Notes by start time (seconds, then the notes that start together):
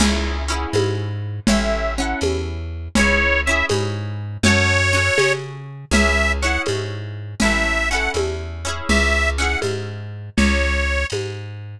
0.00 C#2 C#4 E4 G#4 E5, crash, low conga
0.48 C#4 E4 F#5
0.52 G#4
0.73 G#2, tambourine, high conga
1.47 A1 C#4 E4 E5, low conga
1.52 A4
1.98 C#4 E4 A4 F#5
2.21 E2, tambourine, high conga
2.95 C#2 C#4 E4 C#5, low conga
2.99 G#4
3.45 C#4 E4 E5
3.51 G#4
3.69 G#2, tambourine, high conga
4.43 F#2 C#4 F#4 C#5, low conga
4.48 A4
4.93 C#4 F#4 A4
5.18 C#3, tambourine, high conga
5.91 C#2 C#4 E4 E5, low conga
5.97 G#4
6.42 C#4 E4 F#5
6.47 G#4
6.66 G#2, tambourine, high conga
7.40 A1 C#4 E4 E5, low conga
7.44 A4
7.90 C#4 E4 F#5
7.95 A4
8.14 E2, tambourine, high conga
8.65 C#4 E4 G#4
8.89 C#2 E5, low conga
9.38 C#4 E4 F#5
9.42 G#4
9.62 G#2, tambourine, high conga
10.37 C#2 C#5, low conga
11.10 G#2, tambourine, high conga